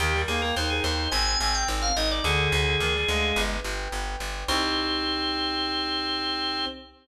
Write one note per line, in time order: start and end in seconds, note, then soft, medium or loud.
0.00 0.24 D#2 loud
0.00 0.13 D#3 loud
0.00 0.22 G4 loud
0.00 0.56 A#4 loud
0.14 0.27 G3 medium
0.28 0.52 D#2 medium
0.28 0.41 A#3 medium
0.28 0.41 G#4 medium
0.28 1.08 G5 medium
0.42 0.55 A#3 medium
0.42 0.55 A#4 medium
0.56 0.80 D#2 medium
0.56 1.09 D#4 loud
0.56 1.09 A#4 medium
0.56 0.70 C5 medium
0.70 0.83 G#4 medium
0.84 1.08 D#2 medium
0.84 1.10 C5 medium
0.84 1.11 D#5 medium
1.11 1.36 G#1 loud
1.11 1.39 C4 medium
1.11 1.68 C5 medium
1.11 1.38 G#5 loud
1.40 1.64 G#1 medium
1.40 1.89 C4 medium
1.40 2.20 G#5 medium
1.40 1.54 G#5 medium
1.55 1.68 G5 loud
1.68 1.92 G#1 medium
1.68 2.21 C5 medium
1.82 1.96 F5 medium
1.96 2.20 G#1 medium
1.96 2.23 D#4 medium
1.96 2.10 D#5 medium
1.96 2.23 D#5 medium
2.11 2.25 D5 loud
2.24 2.48 D2 loud
2.24 2.51 D3 loud
2.24 3.41 G#4 loud
2.24 2.80 D5 loud
2.52 2.76 D2 loud
2.52 2.66 D3 medium
2.52 3.32 G#5 medium
2.66 2.80 D3 medium
2.80 3.04 D2 medium
2.80 2.94 D#3 medium
2.80 3.34 D5 medium
2.95 3.08 G3 medium
3.08 3.32 D2 medium
3.08 3.55 G#3 medium
3.08 3.35 F5 medium
3.36 3.60 G1 loud
3.36 3.92 B4 loud
3.64 3.88 G1 medium
3.64 4.44 G5 medium
3.92 4.16 G1 medium
3.92 4.46 B4 medium
4.20 4.44 G1 medium
4.20 4.47 D5 medium
4.48 6.65 C2 loud
4.48 6.66 C4 loud
4.48 6.66 D#4 loud
4.48 6.66 G4 loud
4.48 6.65 C5 loud